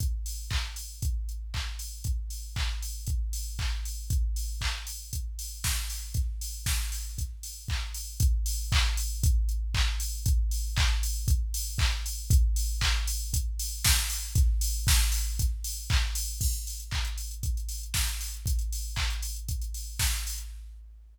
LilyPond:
\new DrumStaff \drummode { \time 4/4 \tempo 4 = 117 <hh bd>8 hho8 <hc bd>8 hho8 <hh bd>8 hh8 <hc bd>8 hho8 | <hh bd>8 hho8 <hc bd>8 hho8 <hh bd>8 hho8 <hc bd>8 hho8 | <hh bd>8 hho8 <hc bd>8 hho8 <hh bd>8 hho8 <bd sn>8 hho8 | <hh bd>8 hho8 <bd sn>8 hho8 <hh bd>8 hho8 <hc bd>8 hho8 |
<hh bd>8 hho8 <hc bd>8 hho8 <hh bd>8 hh8 <hc bd>8 hho8 | <hh bd>8 hho8 <hc bd>8 hho8 <hh bd>8 hho8 <hc bd>8 hho8 | <hh bd>8 hho8 <hc bd>8 hho8 <hh bd>8 hho8 <bd sn>8 hho8 | <hh bd>8 hho8 <bd sn>8 hho8 <hh bd>8 hho8 <hc bd>8 hho8 |
<cymc bd>16 hh16 hho16 hh16 <hc bd>16 hh16 hho16 hh16 <hh bd>16 hh16 hho16 hh16 <bd sn>16 hh16 hho16 hh16 | <hh bd>16 hh16 hho8 <hc bd>16 hh16 hho16 hh16 <hh bd>16 hh16 hho8 <bd sn>16 hh16 hho16 hh16 | }